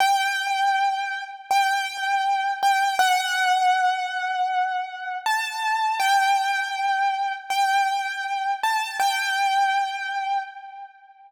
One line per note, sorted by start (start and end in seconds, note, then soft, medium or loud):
0.00 1.23 G5 loud
1.50 2.52 G5 medium
2.62 2.98 G5 medium
2.99 5.15 F#5 loud
5.26 5.98 A5 medium
6.00 7.32 G5 loud
7.50 8.51 G5 medium
8.63 8.95 A5 medium
8.99 10.39 G5 loud